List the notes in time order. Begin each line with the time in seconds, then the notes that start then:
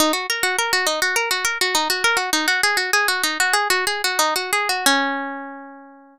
0.00 D#4
0.13 F#4
0.30 A#4
0.43 F#4
0.58 A#4
0.73 F#4
0.87 D#4
1.02 F#4
1.16 A#4
1.31 F#4
1.45 A#4
1.61 F#4
1.75 D#4
1.90 F#4
2.04 A#4
2.17 F#4
2.33 D#4
2.48 F#4
2.63 G#4
2.77 F#4
2.93 G#4
3.08 F#4
3.23 D#4
3.40 F#4
3.53 G#4
3.70 F#4
3.87 G#4
4.04 F#4
4.19 D#4
4.36 F#4
4.53 G#4
4.69 F#4
4.86 C#4